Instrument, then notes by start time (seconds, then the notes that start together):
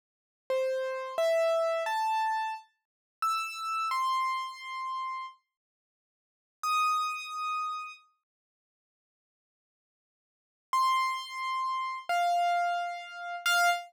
acoustic grand piano
0.50 C5
1.18 E5
1.86 A5
3.22 E6
3.91 C6
6.63 D#6
10.73 C6
12.09 F5
13.46 F5